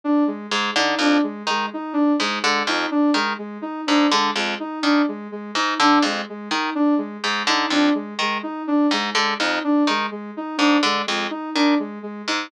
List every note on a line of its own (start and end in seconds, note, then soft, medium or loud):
0.04 0.23 D4 medium
0.27 0.46 G#3 medium
0.51 0.71 G#2 medium
0.51 0.70 G#3 medium
0.76 0.95 D3 medium
0.76 0.95 D#4 medium
0.99 1.18 F2 medium
0.99 1.20 D4 medium
1.23 1.43 G#3 medium
1.47 1.66 D#3 medium
1.47 1.69 G#3 medium
1.73 1.93 D#4 medium
1.93 2.12 D4 medium
2.20 2.39 G#2 medium
2.20 2.39 G#3 medium
2.43 2.63 D3 medium
2.43 2.62 G#3 medium
2.67 2.86 F2 medium
2.67 2.87 D#4 medium
2.91 3.10 D4 medium
3.14 3.33 D#3 medium
3.14 3.34 G#3 medium
3.38 3.58 G#3 medium
3.62 3.81 D#4 medium
3.87 4.07 G#2 medium
3.87 4.06 D4 medium
4.12 4.31 D3 medium
4.12 4.31 G#3 medium
4.36 4.55 F2 medium
4.36 4.55 G#3 medium
4.60 4.79 D#4 medium
4.83 5.02 D#3 medium
4.83 5.02 D4 medium
5.08 5.27 G#3 medium
5.32 5.51 G#3 medium
5.55 5.74 G#2 medium
5.55 5.75 D#4 medium
5.80 5.99 D3 medium
5.80 6.00 D4 medium
6.02 6.22 F2 medium
6.02 6.24 G#3 medium
6.29 6.48 G#3 medium
6.51 6.70 D#3 medium
6.51 6.70 D#4 medium
6.75 6.94 D4 medium
6.98 7.17 G#3 medium
7.23 7.43 G#2 medium
7.23 7.43 G#3 medium
7.47 7.66 D3 medium
7.47 7.67 D#4 medium
7.70 7.90 F2 medium
7.70 7.91 D4 medium
7.95 8.14 G#3 medium
8.19 8.38 D#3 medium
8.19 8.40 G#3 medium
8.43 8.62 D#4 medium
8.67 8.87 D4 medium
8.91 9.10 G#2 medium
8.91 9.12 G#3 medium
9.15 9.34 D3 medium
9.15 9.34 G#3 medium
9.40 9.59 F2 medium
9.40 9.59 D#4 medium
9.64 9.83 D4 medium
9.87 10.06 D#3 medium
9.87 10.08 G#3 medium
10.11 10.31 G#3 medium
10.37 10.56 D#4 medium
10.58 10.78 G#2 medium
10.58 10.77 D4 medium
10.83 11.02 D3 medium
10.83 11.03 G#3 medium
11.06 11.27 F2 medium
11.06 11.26 G#3 medium
11.30 11.50 D#4 medium
11.55 11.75 D#3 medium
11.55 11.74 D4 medium
11.79 11.98 G#3 medium
12.03 12.22 G#3 medium
12.28 12.47 G#2 medium
12.28 12.47 D#4 medium